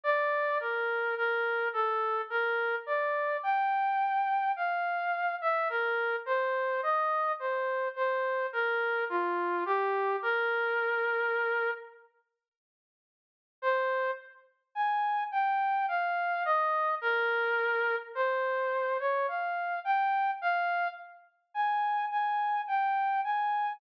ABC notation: X:1
M:3/4
L:1/16
Q:1/4=53
K:Bb
V:1 name="Brass Section"
d2 B2 B2 A2 B2 d2 | g4 f3 =e B2 c2 | e2 c2 c2 B2 F2 G2 | B6 z6 |
[K:Ab] c2 z2 a2 g2 f2 e2 | B4 c3 d f2 g2 | f2 z2 a2 a2 g2 a2 |]